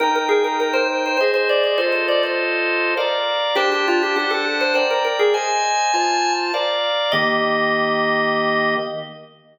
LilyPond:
<<
  \new Staff \with { instrumentName = "Drawbar Organ" } { \time 3/4 \key ees \major \tempo 4 = 101 bes'16 bes'16 aes'16 bes'16 bes'16 c''16 r16 c''16 c''16 c''16 d''16 d''16 | c''16 c''16 d''16 c''4~ c''16 r4 | g'16 g'16 f'16 g'16 g'16 a'16 r16 c''16 c''16 bes'16 bes'16 aes'16 | aes''2 r4 |
ees''2. | }
  \new Staff \with { instrumentName = "Drawbar Organ" } { \time 3/4 \key ees \major <ees' g''>2 <aes' c'' ees''>4 | <f' a' ees''>2 <bes' d'' f''>4 | <d' c'' g'' a''>4 <d' c'' fis'' a''>4 <bes' d'' g''>4 | <c'' ees''>4 <f' c'' a''>4 <bes' d'' f''>4 |
<ees bes g'>2. | }
>>